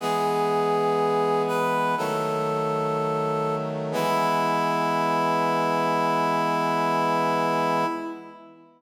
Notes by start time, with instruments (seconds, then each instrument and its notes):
0.00 brass section E3 G#3 B3, clarinet G#4
1.48 clarinet B4
1.98 brass section D#3 F#3 A3, clarinet A4
3.92 brass section E3 G#3 B3, clarinet E4